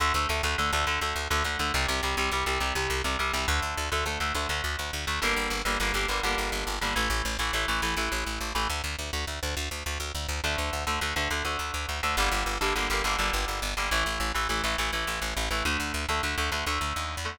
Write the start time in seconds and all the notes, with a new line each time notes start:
0.00 D2 D3 A3
0.14 D2 D3 A3
0.29 D2 D3 A3
0.43 D2 D3 A3
0.58 D2 D3 A3
0.73 D2 D3 A3
0.87 D2 D3 A3
1.01 D2 D3 A3
1.16 D2
1.30 D2 D3 A3
1.44 D2 D3 A3
1.59 D2 D3 A3
1.74 C2 C3 G3
1.88 C2 C3 G3
2.03 C2 C3 G3
2.17 C2 C3 G3
2.31 C2 C3 G3
2.46 C2 C3 G3
2.60 C2 C3 G3
2.75 C2 C3 G3
2.90 C2
3.04 C2 C3 G3
3.19 C2 C3 G3
3.33 C2 C3 G3
3.48 D2 D3 A3
3.62 D2
3.77 D2
3.92 D2 D3 A3
4.06 D2 D3 A3
4.20 D2 D3 A3
4.34 D2 D3 A3
4.49 D2 D3 A3
4.64 D2
4.79 D2
4.93 D2
5.07 D2 D3 A3
5.22 G1 D3 G3 A#3
5.36 G1
5.50 G1
5.65 G1 D3 G3 A#3
5.80 G1 D3 G3 A#3
5.94 G1 D3 G3 A#3
6.08 G1 D3 G3 A#3
6.23 G1 D3 G3 A#3
6.38 G1
6.52 G1
6.67 G1
6.81 G1 D3 G3 A#3
6.96 A1 E3 A3
7.10 A1
7.25 A1
7.39 A1 E3 A3
7.53 A1 E3 A3
7.68 A1 E3 A3
7.82 A1 E3 A3
7.97 A1 E3 A3
8.12 A1
8.26 A1
8.41 A1
8.55 A1 E3 A3
8.70 D2
8.84 D2
8.99 D2
9.13 D2
9.27 D2
9.43 D2
9.57 D2
9.71 D2
9.86 D2
10.00 D2
10.15 D2
10.29 D2
10.44 D2 D3 A3
10.58 D2
10.73 D2
10.87 D2 D3 A3
11.01 D2 D3 A3
11.16 D2 D3 A3
11.30 D2 D3 A3
11.45 D2 D3 A3
11.59 D2
11.74 D2
11.89 D2
12.03 D2 D3 A3
12.17 G1 D3 G3 A#3
12.32 G1
12.46 G1
12.61 G1 D3 G3 A#3
12.75 G1 D3 G3 A#3
12.90 G1 D3 G3 A#3
13.04 G1 D3 G3 A#3
13.19 G1 D3 G3 A#3
13.33 G1
13.48 G1
13.62 G1
13.77 G1 D3 G3 A#3
13.91 A1 E3 A3
14.06 A1
14.20 A1
14.34 A1 E3 A3
14.49 A1 E3 A3
14.64 A1 E3 A3
14.78 A1 E3 A3
14.93 A1 E3 A3
15.07 A1
15.22 A1
15.37 A1
15.51 A1 E3 A3
15.65 D2 D3 A3
15.80 D2
15.94 D2
16.09 D2 D3 A3
16.23 D2 D3 A3
16.38 D2 D3 A3
16.52 D2 D3 A3
16.66 D2 D3 A3
16.81 D2
16.96 D#2
17.17 E2
17.25 D3 A3